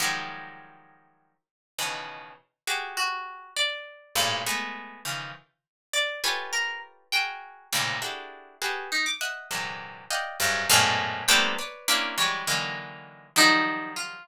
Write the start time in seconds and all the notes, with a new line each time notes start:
0.00 D#3 F3 F#3 G3 G#3
1.78 B2 C#3 D#3 E3
2.67 F#4 G4 G#4
2.97 F#4
3.56 D5
4.15 G2 G#2 A2 A#2
4.46 G#3 A3 B3
5.05 C#3 D#3 E3 F3
5.93 D5
6.24 F4 G4 A4 B4 C#5 G#5
6.53 A#4
7.12 F#4 G#4 A#4 G5
7.73 G#2 A2 A#2 C3 C#3 D#3
8.02 D4 E4 F#4 G4 G#4 A4
8.62 F#4 G4 G#4 A4 B4
8.92 D#4
9.06 D6
9.21 D#5 E5 F#5
9.51 A#2 C3 D3 E3 F#3 G#3
10.11 D5 D#5 F5 F#5 G5
10.40 F#2 G2 G#2
10.70 F#2 G#2 A2 A#2 B2 F5
11.28 G3 A3 A#3 B3 C4 D4 G5
11.59 B4 C#5 D5
11.88 A#3 C4 C#4 D4 E4
12.18 E3 F#3 G3 G#3 C#5
12.47 D3 D#3 E3 F#3 G#3 A#3
13.36 D#3 F3 F#3 G3 D#4
13.96 F4